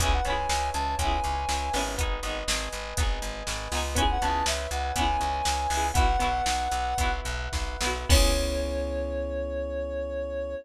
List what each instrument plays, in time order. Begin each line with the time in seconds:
0.00 electric bass (finger) C#2, pizzicato strings B3 C#4 E4, electric piano 1 B4, ocarina G#5, kick, closed hi-hat
0.06 pizzicato strings G#4
0.13 ocarina F#5
0.25 electric bass (finger) C#2, pizzicato strings B3 C#4, electric piano 1 C#5, ocarina G#5, closed hi-hat
0.30 pizzicato strings E4 G#4
0.48 electric bass (finger) C#2, electric piano 1 E5, ocarina G#5, snare
0.73 electric bass (finger) C#2, electric piano 1 G#5, ocarina A5, closed hi-hat
0.99 electric bass (finger) C#2, pizzicato strings B3 C#4, electric piano 1 B4, ocarina G#5, kick, closed hi-hat
1.05 pizzicato strings E4 G#4
1.24 electric bass (finger) C#2, electric piano 1 C#5, closed hi-hat
1.49 electric bass (finger) C#2, electric piano 1 E5, snare
1.73 electric bass (finger) G#1, pizzicato strings B3 C#4, electric piano 1 B4, snare, open hi-hat
1.79 pizzicato strings E4 G#4
1.98 pizzicato strings B3 D#4, kick, closed hi-hat
2.03 pizzicato strings G#4
2.23 electric bass (finger) G#1, pizzicato strings B3 D#4, electric piano 1 D#5, closed hi-hat
2.29 pizzicato strings G#4
2.48 electric bass (finger) G#1, electric piano 1 G#5, snare
2.73 electric bass (finger) G#1, electric piano 1 B4, closed hi-hat
2.97 electric bass (finger) G#1, pizzicato strings B3 D#4, electric piano 1 D#5, kick, closed hi-hat
3.03 pizzicato strings G#4
3.22 electric bass (finger) G#1, electric piano 1 G#5, closed hi-hat
3.47 electric bass (finger) G#1, electric piano 1 B4, snare
3.72 electric bass (finger) C#2, pizzicato strings B3 D#4, electric piano 1 D#5, snare, open hi-hat
3.77 pizzicato strings G#4
3.95 pizzicato strings B3 C#4, electric piano 1 B4, ocarina G#5, kick, closed hi-hat
4.00 pizzicato strings E4 G#4
4.11 ocarina F#5
4.21 electric bass (finger) C#2, pizzicato strings B3 C#4, electric piano 1 C#5, ocarina A5, closed hi-hat
4.27 pizzicato strings E4 G#4
4.46 electric bass (finger) C#2, electric piano 1 E5, ocarina E5, snare
4.71 electric bass (finger) C#2, ocarina F#5, electric piano 1 G#5, closed hi-hat
4.96 electric bass (finger) C#2, pizzicato strings B3 C#4, electric piano 1 B4, ocarina G#5, kick, closed hi-hat
5.01 pizzicato strings E4 G#4
5.20 electric bass (finger) C#2, electric piano 1 C#5, closed hi-hat
5.45 electric bass (finger) C#2, electric piano 1 E5, snare
5.70 electric bass (finger) C#2, pizzicato strings B3 C#4, electric piano 1 G#5, snare, open hi-hat
5.75 pizzicato strings E4 G#4
5.94 electric bass (finger) B1, pizzicato strings B3 E4, electric piano 1 B4, ocarina F#5, kick, closed hi-hat
5.99 pizzicato strings F#4
6.19 electric bass (finger) B1, pizzicato strings B3 E4, electric piano 1 E5, closed hi-hat
6.24 pizzicato strings F#4
6.46 electric bass (finger) B1, electric piano 1 F#5, snare
6.71 electric bass (finger) B1, electric piano 1 B4, closed hi-hat
6.98 electric bass (finger) B1, pizzicato strings B3 E4, electric piano 1 E5, kick, closed hi-hat
7.03 pizzicato strings F#4
7.25 electric bass (finger) B1, electric piano 1 F#5, closed hi-hat
7.52 electric bass (finger) B1, electric piano 1 B4, kick, snare
7.81 electric bass (finger) B1, pizzicato strings B3 E4, electric piano 1 E5, snare
7.87 pizzicato strings F#4
8.09 electric bass (finger) C#2, pizzicato strings B3 C#4, electric piano 1 B3 C#4 E4 G#4, ocarina C#5, kick, crash
8.14 pizzicato strings E4 G#4